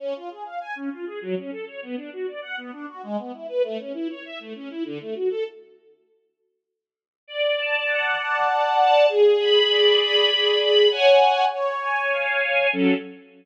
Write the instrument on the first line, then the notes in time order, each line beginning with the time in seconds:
string ensemble 1
0.00 C#4
0.16 F4
0.30 G#4
0.46 F5
0.61 G#5
0.76 C#4
0.91 F4
1.06 G#4
1.21 F#3
1.37 C#4
1.51 A4
1.67 C#5
1.82 B3
1.96 D4
2.13 F#4
2.27 D5
2.42 F#5
2.57 B3
2.72 D4
2.88 F#4
3.03 G#3
3.18 B3
3.33 E4
3.49 B4
3.64 A3
3.79 C#4
3.94 E4
4.09 C#5
4.25 E5
4.40 A3
4.55 C#4
4.70 E4
4.85 D3
5.01 A3
5.15 F#4
5.30 A4
7.28 D5
7.57 A5
7.88 F#5
8.18 A5
8.48 D5
8.79 A5
9.09 G#4
9.40 B5
9.70 D5
10.00 B5
10.31 G#4
10.61 B5
10.91 C#5 F#5 G#5
11.52 C#5
11.81 G#5
12.12 F5
12.42 G#5
12.73 F#3 C#4 A4